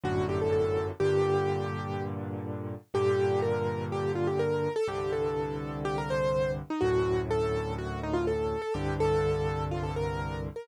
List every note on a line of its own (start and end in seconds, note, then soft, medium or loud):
0.04 0.91 G1 medium
0.04 0.91 F#2 medium
0.04 0.91 A2 medium
0.04 0.91 D3 medium
0.04 0.26 F#4 medium
0.29 0.40 G4 medium
0.41 0.52 A4 medium
0.52 0.86 A4 medium
1.00 2.75 G2 medium
1.00 2.75 A#2 medium
1.00 2.75 D3 medium
1.00 2.03 G4 medium
2.94 4.68 G2 medium
2.94 4.68 A#2 medium
2.94 4.68 D3 medium
2.94 3.41 G4 medium
3.42 3.85 A#4 medium
3.92 4.11 G4 medium
4.15 4.27 F4 medium
4.27 4.39 G4 medium
4.39 4.73 A#4 medium
4.76 4.87 A4 medium
4.88 6.62 C2 medium
4.88 6.62 G2 medium
4.88 6.62 D3 medium
4.88 5.11 G4 medium
5.13 5.79 A4 medium
5.85 5.96 G4 medium
5.98 6.09 A#4 medium
6.10 6.51 C5 medium
6.70 6.82 D#4 medium
6.81 8.56 D2 medium
6.81 8.56 F#2 medium
6.81 8.56 A2 medium
6.81 7.20 F#4 medium
7.31 7.74 A4 medium
7.78 7.99 F#4 medium
8.03 8.15 D#4 medium
8.13 8.25 F4 medium
8.27 8.61 A4 medium
8.62 8.73 A4 medium
8.74 10.49 C2 medium
8.74 10.49 G2 medium
8.74 10.49 D3 medium
8.74 8.94 G4 medium
9.00 9.64 A4 medium
9.71 9.83 F4 medium
9.83 9.95 A4 medium
9.96 10.41 A#4 medium
10.56 10.67 A#4 medium